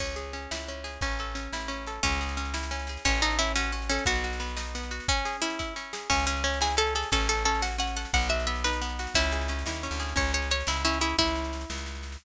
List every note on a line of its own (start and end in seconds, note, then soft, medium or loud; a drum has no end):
0.00 0.47 C#2 medium
0.00 0.33 C#4 medium
0.00 kick medium
0.00 snare medium
0.00 crash loud
0.16 0.84 G#4 medium
0.16 snare medium
0.33 0.68 C#4 medium
0.33 snare medium
0.51 0.98 C#2 medium
0.51 1.00 E4 medium
0.51 snare loud
0.68 1.01 C#4 medium
0.68 snare medium
0.84 1.00 G#4 medium
0.84 snare medium
1.01 1.48 A1 medium
1.01 1.35 C#4 medium
1.01 kick loud
1.01 snare medium
1.19 1.87 A4 medium
1.19 snare medium
1.35 1.68 C#4 medium
1.35 snare medium
1.53 1.99 A1 medium
1.53 2.01 E4 medium
1.53 snare loud
1.68 2.00 C#4 medium
1.68 snare medium
1.87 2.03 A4 medium
1.87 snare medium
2.03 2.97 C#2 loud
2.03 2.98 C#4 medium
2.03 2.37 C#4 medium
2.03 kick loud
2.03 snare medium
2.12 snare medium
2.21 2.89 G#4 medium
2.21 snare medium
2.29 snare medium
2.37 2.71 C#4 medium
2.37 snare medium
2.45 snare medium
2.54 3.02 E4 medium
2.54 snare loud
2.63 snare medium
2.71 3.03 C#4 medium
2.71 snare medium
2.79 snare medium
2.87 3.05 G#4 medium
2.87 snare medium
2.97 snare medium
3.05 3.99 A1 loud
3.05 3.21 C#4 medium
3.05 3.39 C#4 medium
3.05 kick loud
3.05 snare medium
3.15 snare medium
3.22 3.38 D#4 medium
3.22 3.91 A4 medium
3.22 snare medium
3.31 snare medium
3.39 3.72 C#4 medium
3.39 3.53 E4 medium
3.39 snare medium
3.47 snare medium
3.56 3.72 C#4 medium
3.56 4.04 F#4 medium
3.56 snare loud
3.63 snare medium
3.72 4.05 C#4 medium
3.72 snare medium
3.82 snare medium
3.89 4.04 C#4 medium
3.89 4.07 A4 medium
3.89 snare medium
3.99 snare medium
4.06 5.00 B1 loud
4.06 4.39 B3 medium
4.06 4.89 F#4 medium
4.06 kick loud
4.06 snare medium
4.16 snare medium
4.24 4.91 F#4 medium
4.24 snare medium
4.33 snare medium
4.40 4.74 B3 medium
4.40 snare medium
4.49 snare medium
4.57 5.05 D#4 medium
4.57 snare loud
4.66 snare medium
4.75 5.07 B3 medium
4.75 snare medium
4.83 snare medium
4.91 5.07 F#4 medium
4.91 snare medium
5.00 snare medium
5.08 5.42 C#4 medium
5.08 5.37 C#4 medium
5.08 kick loud
5.08 snare medium
5.17 snare medium
5.25 5.92 G#4 medium
5.25 snare medium
5.33 snare medium
5.42 5.76 C#4 medium
5.42 5.74 E4 medium
5.42 snare medium
5.50 snare medium
5.59 6.07 E4 medium
5.59 kick medium
5.59 snare medium
5.76 6.08 C#4 medium
5.76 snare medium
5.93 6.09 G#4 medium
5.93 snare loud
6.10 7.04 C#2 loud
6.10 6.25 C#4 medium
6.10 6.44 C#4 medium
6.10 kick loud
6.10 snare medium
6.10 crash loud
6.19 snare medium
6.26 6.43 C#4 medium
6.26 6.95 G#4 medium
6.26 snare medium
6.37 snare medium
6.44 6.59 C#4 medium
6.44 6.76 C#4 medium
6.44 snare medium
6.54 snare medium
6.61 7.09 E4 medium
6.61 6.75 G#4 medium
6.61 snare loud
6.71 snare medium
6.77 7.09 C#4 medium
6.77 6.94 A4 medium
6.77 snare medium
6.87 snare medium
6.95 7.11 G#4 medium
6.95 7.10 A4 medium
6.95 snare medium
7.03 snare medium
7.12 8.06 A1 loud
7.12 7.45 C#4 medium
7.12 7.27 A4 medium
7.12 kick loud
7.12 snare medium
7.20 snare medium
7.29 7.44 A4 medium
7.29 7.96 A4 medium
7.29 snare medium
7.37 snare medium
7.45 7.78 C#4 medium
7.45 7.62 A4 medium
7.45 snare medium
7.55 snare medium
7.62 8.10 F#4 medium
7.62 7.77 F#5 medium
7.62 snare loud
7.72 snare medium
7.78 8.11 C#4 medium
7.78 7.96 F#5 medium
7.78 snare medium
7.87 snare medium
7.96 8.12 A4 medium
7.96 8.12 F#5 medium
7.96 snare medium
8.05 snare medium
8.13 9.07 B1 loud
8.13 8.47 B3 medium
8.13 8.28 F#5 medium
8.13 kick loud
8.13 snare medium
8.22 snare medium
8.29 8.99 F#4 medium
8.29 8.46 E5 medium
8.29 snare medium
8.40 snare medium
8.47 8.81 B3 medium
8.47 8.63 E5 medium
8.47 snare medium
8.56 snare medium
8.64 9.13 D#4 medium
8.64 9.12 B4 medium
8.64 snare loud
8.73 snare medium
8.82 9.14 B3 medium
8.82 snare medium
8.89 snare medium
8.99 9.15 F#4 medium
8.99 snare medium
9.07 snare medium
9.14 9.64 C#2 loud
9.14 9.49 C#4 medium
9.14 9.84 E4 medium
9.14 kick loud
9.14 snare medium
9.24 snare medium
9.32 9.99 G#4 medium
9.32 snare medium
9.41 snare medium
9.48 9.83 C#4 medium
9.48 snare medium
9.59 snare medium
9.66 9.88 D#2 medium
9.66 10.15 E4 medium
9.66 snare loud
9.74 snare medium
9.83 10.15 C#4 medium
9.83 snare medium
9.91 10.14 D2 medium
9.91 snare medium
10.00 10.16 G#4 medium
10.00 snare medium
10.08 snare medium
10.16 10.63 C#2 loud
10.16 10.50 C#4 medium
10.16 10.32 C#5 medium
10.16 kick loud
10.16 snare medium
10.25 snare medium
10.34 11.00 G#4 medium
10.34 10.49 C#5 medium
10.34 snare medium
10.42 snare medium
10.51 10.84 C#4 medium
10.51 10.68 C#5 medium
10.51 snare medium
10.60 snare medium
10.67 11.14 C#2 medium
10.67 10.83 E4 medium
10.67 11.17 E4 medium
10.67 snare loud
10.76 snare medium
10.85 11.17 C#4 medium
10.85 10.99 E4 medium
10.85 snare medium
10.93 snare medium
11.01 11.16 E4 medium
11.01 11.17 G#4 medium
11.01 snare medium
11.09 snare medium
11.18 11.65 C#2 medium
11.18 12.18 E4 medium
11.18 kick loud
11.18 snare medium
11.28 snare medium
11.36 snare medium
11.44 snare medium
11.53 snare medium
11.61 snare medium
11.70 12.17 C#2 medium
11.70 snare loud
11.78 snare medium
11.86 snare medium
11.95 snare medium
12.03 snare medium
12.12 snare medium